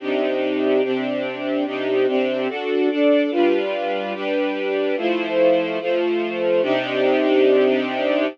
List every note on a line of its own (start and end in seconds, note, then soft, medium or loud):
0.00 0.82 C3 medium
0.00 0.82 D4 medium
0.00 0.82 D#4 medium
0.00 0.82 G4 medium
0.83 1.65 C3 medium
0.83 1.65 C4 medium
0.83 1.65 D4 medium
0.83 1.65 G4 medium
1.66 2.06 C3 medium
1.66 2.06 D4 medium
1.66 2.06 D#4 medium
1.66 2.06 G4 medium
2.07 2.48 C3 medium
2.07 2.48 C4 medium
2.07 2.48 D4 medium
2.07 2.48 G4 medium
2.48 2.89 D4 medium
2.48 2.89 F#4 medium
2.48 2.89 A4 medium
2.90 3.31 D4 medium
2.90 3.31 A4 medium
2.90 3.31 D5 medium
3.31 4.13 G3 medium
3.31 4.13 D4 medium
3.31 4.13 F4 medium
3.31 4.13 B4 medium
4.14 4.96 G3 medium
4.14 4.96 D4 medium
4.14 4.96 G4 medium
4.14 4.96 B4 medium
4.97 5.79 F3 medium
4.97 5.79 A3 medium
4.97 5.79 E4 medium
4.97 5.79 C5 medium
5.80 6.61 F3 medium
5.80 6.61 A3 medium
5.80 6.61 F4 medium
5.80 6.61 C5 medium
6.62 8.26 C3 loud
6.62 8.26 D4 loud
6.62 8.26 D#4 medium
6.62 8.26 G4 loud